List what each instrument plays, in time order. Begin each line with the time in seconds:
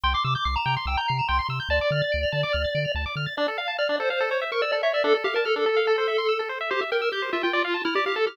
0.03 synth bass 1 C2, lead 1 (square) G5 C6
0.14 lead 1 (square) C6 D6
0.24 synth bass 1 C3, lead 1 (square) D6 E6
0.35 lead 1 (square) D6 G6
0.45 synth bass 1 C2, lead 1 (square) D6 C7
0.56 lead 1 (square) A#5 E7
0.66 synth bass 1 C3, lead 1 (square) G5
0.77 lead 1 (square) C6
0.86 synth bass 1 C2, lead 1 (square) G5 E6
0.97 lead 1 (square) A#5 G6
1.08 synth bass 1 C3, lead 1 (square) C7
1.19 lead 1 (square) E7
1.28 synth bass 1 C2, lead 1 (square) G5 C6
1.39 lead 1 (square) C6
1.49 synth bass 1 C3, lead 1 (square) E6
1.60 lead 1 (square) G6
1.69 synth bass 1 D2, lead 1 (square) D5 A5
1.81 lead 1 (square) D6
1.91 synth bass 1 D3, lead 1 (square) F6
2.02 lead 1 (square) A6
2.12 synth bass 1 D2, lead 1 (square) D7
2.23 lead 1 (square) F7
2.32 synth bass 1 D3, lead 1 (square) A5
2.43 lead 1 (square) D6
2.53 synth bass 1 D2, lead 1 (square) F6
2.64 lead 1 (square) A6
2.75 synth bass 1 D3, lead 1 (square) D7
2.85 lead 1 (square) F7
2.95 synth bass 1 D2, lead 1 (square) A5
3.06 lead 1 (square) D6
3.16 synth bass 1 D3, lead 1 (square) F6
3.26 lead 1 (square) A6
3.37 lead 1 (square) D4 D5
3.48 lead 1 (square) A4
3.58 lead 1 (square) F5
3.68 lead 1 (square) A5
3.78 lead 1 (square) D5 F6
3.89 lead 1 (square) D4
4.00 lead 1 (square) A4 C5
4.10 lead 1 (square) C5 F5
4.20 lead 1 (square) A4
4.31 lead 1 (square) C#5
4.41 lead 1 (square) E5
4.52 lead 1 (square) A#4 C#6
4.62 lead 1 (square) D5 E6
4.72 lead 1 (square) A4 D5
4.83 lead 1 (square) C#5 E5
4.93 lead 1 (square) D5 E5
5.04 lead 1 (square) D4 A4
5.14 lead 1 (square) A4
5.24 lead 1 (square) G4 F5
5.34 lead 1 (square) A#4 A5
5.45 lead 1 (square) A4 F6
5.56 lead 1 (square) D4 A4
5.66 lead 1 (square) A4
5.77 lead 1 (square) F5
5.87 lead 1 (square) A4
5.98 lead 1 (square) C5
6.08 lead 1 (square) E5
6.18 lead 1 (square) C6
6.29 lead 1 (square) E6
6.39 lead 1 (square) A4
6.49 lead 1 (square) C5
6.61 lead 1 (square) E5
6.70 lead 1 (square) G4 C5
6.81 lead 1 (square) E5
6.92 lead 1 (square) A#4 G5
7.02 lead 1 (square) E6
7.12 lead 1 (square) G4 G6
7.22 lead 1 (square) C5
7.33 lead 1 (square) F4 E5
7.43 lead 1 (square) F4 G5
7.53 lead 1 (square) D5
7.64 lead 1 (square) F5
7.74 lead 1 (square) A5
7.85 lead 1 (square) E4 F6
7.95 lead 1 (square) G4 D5
8.06 lead 1 (square) G4 F5
8.16 lead 1 (square) A4 A5
8.27 lead 1 (square) G4 F6